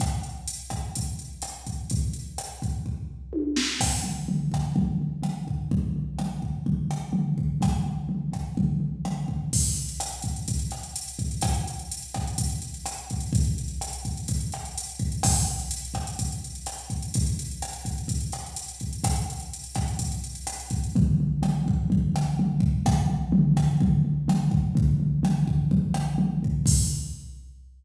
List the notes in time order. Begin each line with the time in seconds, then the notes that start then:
0.00 kick, cross-stick, closed hi-hat
0.23 closed hi-hat
0.48 closed hi-hat
0.70 kick, cross-stick, closed hi-hat
0.95 kick, closed hi-hat
1.19 closed hi-hat
1.42 cross-stick, closed hi-hat
1.67 kick, closed hi-hat
1.90 kick, closed hi-hat
2.13 closed hi-hat
2.38 cross-stick, closed hi-hat
2.62 kick, closed hi-hat
2.86 kick
3.33 high tom
3.56 snare
3.80 kick, cross-stick, crash
4.04 floor tom
4.28 floor tom
4.52 kick, cross-stick, floor tom
4.76 kick, floor tom
5.01 floor tom
5.23 cross-stick, floor tom
5.47 kick, floor tom
5.71 kick, floor tom
5.96 floor tom
6.19 cross-stick, floor tom
6.42 kick, floor tom
6.66 kick, floor tom
6.91 cross-stick, floor tom
7.13 floor tom
7.38 kick, floor tom
7.61 kick, cross-stick, floor tom
7.86 floor tom
8.09 floor tom
8.32 kick, cross-stick, floor tom
8.57 kick, floor tom
8.80 floor tom
9.05 cross-stick, floor tom
9.28 kick, floor tom
9.53 kick, crash
9.65 closed hi-hat
9.76 closed hi-hat
9.89 closed hi-hat
10.00 cross-stick, closed hi-hat
10.12 closed hi-hat
10.22 kick, closed hi-hat
10.36 closed hi-hat
10.48 kick, closed hi-hat
10.59 closed hi-hat
10.71 cross-stick, closed hi-hat
10.83 closed hi-hat
10.96 closed hi-hat
11.08 closed hi-hat
11.19 kick, closed hi-hat
11.31 closed hi-hat
11.41 kick, cross-stick, closed hi-hat
11.54 closed hi-hat
11.68 closed hi-hat
11.79 closed hi-hat
11.91 closed hi-hat
12.02 closed hi-hat
12.14 kick, cross-stick, closed hi-hat
12.27 closed hi-hat
12.38 kick, closed hi-hat
12.50 closed hi-hat
12.62 closed hi-hat
12.74 closed hi-hat
12.86 cross-stick, closed hi-hat
12.98 closed hi-hat
13.10 kick, closed hi-hat
13.20 closed hi-hat
13.33 kick, closed hi-hat
13.45 closed hi-hat
13.58 closed hi-hat
13.68 closed hi-hat
13.81 cross-stick, closed hi-hat
13.93 closed hi-hat
14.05 kick, closed hi-hat
14.17 closed hi-hat
14.28 kick, closed hi-hat
14.40 closed hi-hat
14.52 cross-stick, closed hi-hat
14.65 closed hi-hat
14.78 closed hi-hat
14.89 closed hi-hat
14.99 kick, closed hi-hat
15.12 closed hi-hat
15.23 kick, cross-stick, crash
15.36 closed hi-hat
15.47 closed hi-hat
15.60 closed hi-hat
15.71 closed hi-hat
15.85 closed hi-hat
15.94 kick, cross-stick, closed hi-hat
16.07 closed hi-hat
16.19 kick, closed hi-hat
16.32 closed hi-hat
16.44 closed hi-hat
16.55 closed hi-hat
16.66 cross-stick, closed hi-hat
16.78 closed hi-hat
16.90 kick, closed hi-hat
17.02 closed hi-hat
17.14 kick, closed hi-hat
17.26 closed hi-hat
17.39 closed hi-hat
17.51 closed hi-hat
17.62 cross-stick, closed hi-hat
17.73 closed hi-hat
17.85 kick, closed hi-hat
17.98 closed hi-hat
18.08 kick, closed hi-hat
18.20 closed hi-hat
18.32 cross-stick, closed hi-hat
18.46 closed hi-hat
18.56 closed hi-hat
18.68 closed hi-hat
18.80 kick, closed hi-hat
18.93 closed hi-hat
19.04 kick, cross-stick, closed hi-hat
19.16 closed hi-hat
19.30 closed hi-hat
19.40 closed hi-hat
19.53 closed hi-hat
19.64 closed hi-hat
19.75 kick, cross-stick, closed hi-hat
19.88 closed hi-hat
19.99 kick, closed hi-hat
20.12 closed hi-hat
20.24 closed hi-hat
20.35 closed hi-hat
20.47 cross-stick, closed hi-hat
20.60 closed hi-hat
20.70 kick, closed hi-hat
20.84 closed hi-hat
20.96 kick, floor tom
21.20 floor tom
21.42 cross-stick, floor tom
21.66 kick, floor tom
21.90 kick, floor tom
22.14 cross-stick, floor tom
22.39 floor tom
22.60 kick, floor tom
22.86 kick, cross-stick, floor tom
23.09 floor tom
23.32 floor tom
23.56 kick, cross-stick, floor tom
23.80 kick, floor tom
24.05 floor tom
24.28 cross-stick, floor tom
24.51 kick, floor tom
24.75 kick, floor tom
25.00 floor tom
25.23 cross-stick, floor tom
25.48 kick, floor tom
25.71 kick, floor tom
25.94 cross-stick, floor tom
26.18 floor tom
26.43 kick, floor tom
26.66 kick, crash